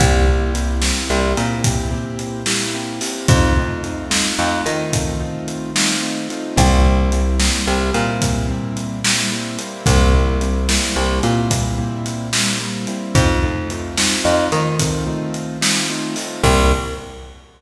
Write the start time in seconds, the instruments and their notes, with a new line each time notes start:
0.00 electric bass (finger) C2, acoustic grand piano A#3 C4 E4 G4, kick, closed hi-hat
0.28 acoustic grand piano A#3 C4 E4 G4
0.54 acoustic grand piano A#3 C4 E4 G4, closed hi-hat
0.82 acoustic grand piano A#3 C4 E4 G4, snare
1.10 electric bass (finger) C2, acoustic grand piano A#3 C4 E4 G4
1.37 electric bass (finger) A#2, acoustic grand piano A#3 C4 E4 G4, closed hi-hat
1.64 acoustic grand piano A#3 C4 E4 G4, kick, closed hi-hat
1.91 acoustic grand piano A#3 C4 E4 G4
2.19 closed hi-hat
2.46 acoustic grand piano A#3 C4 E4 G4, snare
2.74 acoustic grand piano A#3 C4 E4 G4
3.01 acoustic grand piano A#3 C4 E4 G4, open hi-hat
3.28 electric bass (finger) F2, acoustic grand piano A3 C4 D#4 F4, kick, closed hi-hat
3.56 acoustic grand piano A3 C4 D#4 F4
3.83 acoustic grand piano A3 C4 D#4 F4, closed hi-hat
4.10 acoustic grand piano A3 C4 D#4 F4, snare
4.38 electric bass (finger) F2, acoustic grand piano A3 C4 D#4 F4
4.66 electric bass (finger) D#3, acoustic grand piano A3 C4 D#4 F4, closed hi-hat
4.93 acoustic grand piano A3 C4 D#4 F4, kick, closed hi-hat
5.20 acoustic grand piano A3 C4 D#4 F4
5.48 closed hi-hat
5.75 acoustic grand piano A3 C4 D#4 F4, snare
6.02 acoustic grand piano A3 C4 D#4 F4
6.30 acoustic grand piano A3 C4 D#4 F4, closed hi-hat
6.56 electric bass (finger) C2, acoustic grand piano G3 A#3 C4 E4, kick, closed hi-hat
6.85 acoustic grand piano G3 A#3 C4 E4
7.12 acoustic grand piano G3 A#3 C4 E4, closed hi-hat
7.39 acoustic grand piano G3 A#3 C4 E4, snare
7.66 electric bass (finger) C2, acoustic grand piano G3 A#3 C4 E4
7.94 electric bass (finger) A#2, acoustic grand piano G3 A#3 C4 E4, closed hi-hat
8.22 acoustic grand piano G3 A#3 C4 E4, kick, closed hi-hat
8.49 acoustic grand piano G3 A#3 C4 E4
8.77 closed hi-hat
9.04 acoustic grand piano G3 A#3 C4 E4, snare
9.32 acoustic grand piano G3 A#3 C4 E4
9.59 acoustic grand piano G3 A#3 C4 E4, closed hi-hat
9.86 electric bass (finger) C2, acoustic grand piano G3 A#3 C4 E4, kick, closed hi-hat
10.13 acoustic grand piano G3 A#3 C4 E4
10.41 acoustic grand piano G3 A#3 C4 E4, closed hi-hat
10.69 acoustic grand piano G3 A#3 C4 E4, snare
10.96 electric bass (finger) C2, acoustic grand piano G3 A#3 C4 E4
11.23 electric bass (finger) A#2, acoustic grand piano G3 A#3 C4 E4, closed hi-hat
11.50 acoustic grand piano G3 A#3 C4 E4, kick, closed hi-hat
11.78 acoustic grand piano G3 A#3 C4 E4
12.06 closed hi-hat
12.33 acoustic grand piano G3 A#3 C4 E4, snare
12.60 acoustic grand piano G3 A#3 C4 E4
12.87 acoustic grand piano G3 A#3 C4 E4, closed hi-hat
13.14 electric bass (finger) F2, acoustic grand piano A3 C4 D#4 F4, kick, closed hi-hat
13.43 acoustic grand piano A3 C4 D#4 F4
13.70 acoustic grand piano A3 C4 D#4 F4, closed hi-hat
13.97 acoustic grand piano A3 C4 D#4 F4, snare
14.24 electric bass (finger) F2, acoustic grand piano A3 C4 D#4 F4
14.51 electric bass (finger) D#3, acoustic grand piano A3 C4 D#4 F4, closed hi-hat
14.79 acoustic grand piano A3 C4 D#4 F4, kick, closed hi-hat
15.07 acoustic grand piano A3 C4 D#4 F4
15.34 closed hi-hat
15.61 acoustic grand piano A3 C4 D#4 F4, snare
15.90 acoustic grand piano A3 C4 D#4 F4
16.16 acoustic grand piano A3 C4 D#4 F4, open hi-hat
16.43 electric bass (finger) C2, acoustic grand piano A#3 C4 E4 G4, kick, crash